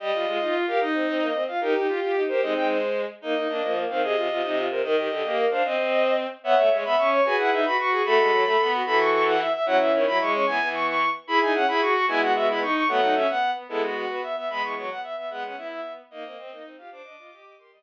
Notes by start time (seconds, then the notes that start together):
0.00 G3 G4 D#5
0.14 G3 F4
0.26 G#3 F4
0.40 D#4 F4
0.54 F4
0.67 G4 A#4 F5
0.81 D#4 D#5
0.93 C4
1.07 C4
1.21 A#3
1.34 C4
1.48 F4 F5
1.61 D#4 G4 A#4
1.75 D#4 G4
1.87 F4 G4
2.01 F4 G4
2.16 D#4
2.28 G4 A#4 C5
2.41 G#3 C4 D#4 D#5
2.55 G#3 G5
2.68 C5
3.21 A#3 D#4 D#5
3.35 A#3 D#4
3.48 A#3 D4
3.62 F3 A#3
3.76 A#3
3.89 D#3 C4 F5
4.03 C3 G#4 D#5
4.15 C3 F4
4.29 C3 F4
4.42 C3 D#4
4.57 F4
4.70 C3 A#4 C5
4.83 D#3 A#4 D#5
4.96 D#3 G4
5.10 D3 G4
5.24 A#3 G4
5.37 A#4
5.50 D4 C5 F5
5.64 C4 C5 D#5
5.77 C4
5.90 D#5
6.44 B3 C#5 E5 F#5
6.57 A3 E5
6.71 G#3 C#5
6.84 B3 E5 B5
6.98 C#4 C#6
7.12 C#5 C#6
7.24 F#4 G#4 B4 G#5
7.38 E4 F#5
7.52 D#4 E5
7.65 F#4 B4 B5
7.78 F#4 C#6
7.92 G#4 C#6
8.05 A3 F#4 A4 B5
8.18 G#3
8.32 F#3
8.45 A3 A4
8.60 B3
8.74 F#4
8.86 E3 F#4 A4 B5
8.99 C#6
9.13 C#6
9.27 F#5
9.40 E5
9.53 E5
9.66 F#3 C#4 E4 F#5
9.80 E3 E5
9.93 D#3 C#5
10.07 F#3 E4 B5
10.20 G#3 C#6
10.33 C#4 C#6
10.47 E3 B3 G#5
10.60 E3 B3
10.74 C#6
10.87 C#6
11.27 E4 G#4 B5
11.41 D#4 G#5
11.54 C#4 F#5
11.68 E4 G#4 B5
11.81 F#4 C#6
11.94 F#4 C#6
12.08 G#3 B3 E4 G#5
12.21 F#4 F#5
12.35 F#4 E5
12.49 E4 B5
12.62 D#4 C#6
12.75 C#6
12.88 F#3 A3 B3 F#5
13.02 D#4
13.15 C#4 E5
13.29 B3 F#5
13.55 B3
13.69 G#3 B3 E4 A4
13.82 F#4
13.96 F#4
14.10 B3 B4
14.23 E5
14.36 B3 E5
14.49 G#3 B3 B5
14.63 E3 C#6
14.77 F#3 C#6
14.90 B3 F#5
15.03 E5
15.17 B3 E5
15.30 G#3 B3 F#5
15.44 C#4 F#5
15.57 B3 E4 E5
15.71 E5
16.10 A#3 D#4 D#5
16.24 A#3 C4
16.37 C4
16.50 A#3 D#4
16.65 C4
16.78 F4 G4 F5
16.91 D4 C5 D6
17.04 D4 D#5
17.18 F4 D#5
17.31 G4 D#5
17.45 D#5
17.58 G4 A#4 C6
17.72 G3 D#5